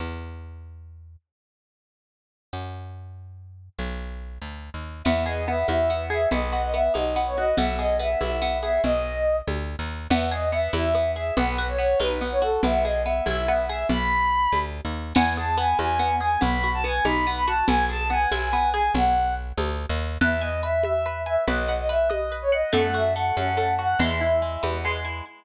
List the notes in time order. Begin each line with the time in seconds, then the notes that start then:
0.00 E2
2.53 F#2
3.79 B1
4.42 D2
4.74 D#2
5.04 E2 B3 E5, crash, low conga
5.26 G#4 D#5
5.48 B3 E5
5.68 E2 E4 E5, high conga
5.90 B3
6.10 G#4 E5
6.31 B1 B3 D#5, low conga
6.52 F#4
6.63 D#5
6.74 B3 E5
6.94 B1 D#4 D#5, high conga
7.16 B3
7.26 C#5
7.37 F#4 D#5
7.57 B1 B3 E5, low conga
7.79 G#4 D#5
8.00 B3 E5
8.21 B1 E4 E5, high conga
8.42 B3
8.63 G#4 E5
8.84 B1 D#5, low conga
9.47 D2, high conga
9.79 D#2
10.10 E2 B3 E5, crash, low conga
10.31 G#4 D#5
10.52 B3 E5
10.73 E2 E4 E5, high conga
10.95 B3
11.16 G#4 E5
11.37 B1 B3 B4, low conga
11.58 F#4
11.68 C#5
11.78 B3 C#5
12.00 B1 D#4 B4, high conga
12.21 B3
12.32 C#5
12.42 F#4 A4
12.63 B1 B3 E5, low conga
12.84 G#4 D#5
13.04 B3 E5
13.26 B1 E4 E5, high conga
13.48 B3
13.69 G#4 E5
13.89 B1 B5, low conga
14.52 D2, high conga
14.85 D#2
15.14 E2 B3 G#5, crash, low conga
15.37 G#4 A5
15.57 B3 G#5
15.79 E2 E4 G#5, high conga
15.99 B3
16.21 G#4 G#5
16.41 B1 B3 B5, low conga
16.64 F#4
16.74 A5
16.84 B3 G#5
17.04 B1 D#4 B5, high conga
17.27 B3
17.36 B5
17.46 F#4 A5
17.67 B1 B3 G#5, low conga
17.89 G#4 A5
18.10 B3 G#5
18.31 B1 E4 G#5, high conga
18.53 B3
18.74 G#4 G#5
18.94 B1 F#5, low conga
19.57 D2, high conga
19.89 D#2
20.21 E2 B4 E5, low conga
20.41 D#5 G#5
20.63 B4 E5
20.84 E5, high conga
21.06 B4
21.26 E5 G#5
21.48 B1 B4 D#5, low conga
21.68 F#5
21.79 D#5
21.89 B4 E5
22.10 D#5, high conga
22.32 B4
22.42 C#5
22.52 D#5 F#5
22.73 F#2 A3 F#5, low conga
22.94 F#4 E5
23.16 A3 F#5
23.36 F#2 C#4 F#5, high conga
23.57 A3
23.79 F#4 F#5
23.99 E2 G#3 E5, low conga
24.21 E4
24.42 G#3
24.63 E2 B3, high conga
24.85 G#3
25.05 E4